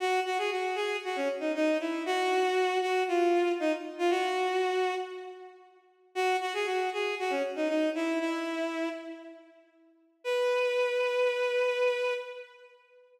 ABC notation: X:1
M:4/4
L:1/16
Q:1/4=117
K:B
V:1 name="Violin"
F2 F G F2 G2 F C z D D2 E2 | F6 F2 ^E4 D z2 E | F8 z8 | F2 F G F2 G2 F C z D D2 E2 |
E6 z10 | B16 |]